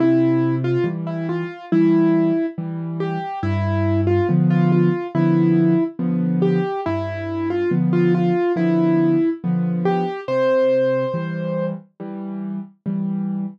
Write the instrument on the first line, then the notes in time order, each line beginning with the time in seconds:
acoustic grand piano
0.00 C3 E4
0.64 F4
0.84 E3 G3
1.07 E4
1.29 F4
1.72 E3 G3 E4
2.58 E3 G3
3.00 G4
3.43 G2 E4
4.07 F4
4.29 D3 F3 B3
4.50 F4
4.72 F4
5.15 D3 F3 B3 E4
5.99 D3 F3 B3
6.42 G4
6.86 G2 E4
7.50 F4
7.71 D3 F3 B3
7.93 F4
8.14 F4
8.56 D3 F3 B3 E4
9.44 D3 F3 B3
9.85 G4
10.28 C3 C5
11.14 E3 G3
12.00 E3 G3
12.86 E3 G3